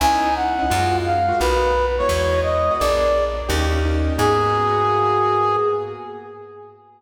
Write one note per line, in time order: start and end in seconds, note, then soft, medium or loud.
0.00 0.62 C#2 loud
0.00 0.30 B3 medium
0.00 0.30 C#4 loud
0.00 0.30 D#4 loud
0.00 0.30 E4 medium
0.00 0.34 G#5 medium
0.36 0.97 F#5 medium
0.59 0.66 B3 medium
0.59 0.66 C#4 medium
0.59 0.66 D#4 medium
0.59 0.66 E4 medium
0.70 1.33 F#2 loud
0.70 0.99 G#3 loud
0.70 0.99 A#3 medium
0.70 0.99 F4 loud
0.70 0.99 F#4 medium
1.05 1.39 F5 medium
1.29 1.36 G#3 medium
1.29 1.36 A#3 medium
1.29 1.36 F4 medium
1.29 1.36 F#4 medium
1.40 2.02 B1 loud
1.40 1.68 A#3 medium
1.40 1.68 B3 medium
1.40 1.68 D#4 loud
1.40 1.68 F#4 medium
1.40 1.86 B4 medium
1.98 2.39 G#3 medium
1.98 2.39 B3 loud
1.98 2.39 E4 medium
1.98 2.39 F#4 loud
1.98 2.41 C#5 medium
2.09 2.70 E2 loud
2.43 2.74 D#5 medium
2.71 2.78 G#3 medium
2.71 2.78 B3 medium
2.71 2.78 E4 medium
2.71 2.78 F#4 loud
2.79 3.43 A#1 loud
2.79 3.09 A#3 loud
2.79 3.09 B3 medium
2.79 3.09 D4 loud
2.79 3.09 G#4 medium
2.79 3.25 D5 loud
3.49 4.11 D#2 loud
3.49 3.66 A#3 loud
3.49 3.66 C#4 medium
3.49 3.66 D#4 loud
3.49 3.66 G4 loud
3.72 3.79 A#3 medium
3.72 3.79 C#4 medium
3.72 3.79 D#4 medium
3.72 3.79 G4 medium
3.85 4.14 A#3 medium
3.85 4.14 C#4 medium
3.85 4.14 D#4 medium
3.85 4.14 G4 medium
4.18 5.57 G#2 loud
4.18 5.57 A#3 loud
4.18 5.57 B3 loud
4.18 5.57 F#4 loud
4.18 5.56 G#4 loud
4.18 5.57 G#4 medium